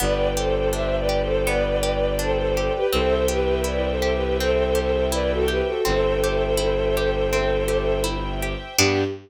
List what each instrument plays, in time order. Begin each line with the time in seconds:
0.00 violin G1 B4 D5, orchestral harp B3, string ensemble 1 B4 D5 G5
0.37 orchestral harp G4, violin A4 C5
0.73 orchestral harp D4, violin C5 E5
0.97 violin B4 D5
1.09 orchestral harp G4
1.22 violin A4 C5
1.46 orchestral harp B3, violin B4 D5
1.83 orchestral harp G4
2.19 orchestral harp D4, violin A4 C5
2.37 violin A4 C5
2.55 orchestral harp G4, violin A4 C5
2.74 violin G4 B4
2.92 violin C2 A4 C5, orchestral harp C4, string ensemble 1 C5 E5 G5
3.28 orchestral harp G4, violin G4 B4
3.64 orchestral harp E4, violin B4 D5
3.90 violin A4 C5
4.02 orchestral harp G4
4.14 violin G4 B4
4.39 orchestral harp C4, violin A4 C5
4.75 orchestral harp G4
5.12 orchestral harp E4, violin B4 D5
5.31 violin F#4 A4
5.48 orchestral harp G4, violin G4 B4
5.67 violin F#4 A4
5.85 violin G1 A4 C5, orchestral harp C4, string ensemble 1 C5 E5 G5
6.24 orchestral harp G4
6.57 orchestral harp E4
6.97 orchestral harp G4
7.33 orchestral harp C4
7.68 orchestral harp G4
8.04 orchestral harp E4
8.42 orchestral harp G4
8.78 violin G2 G4, orchestral harp B3 D4 G4, string ensemble 1 B3 D4 G4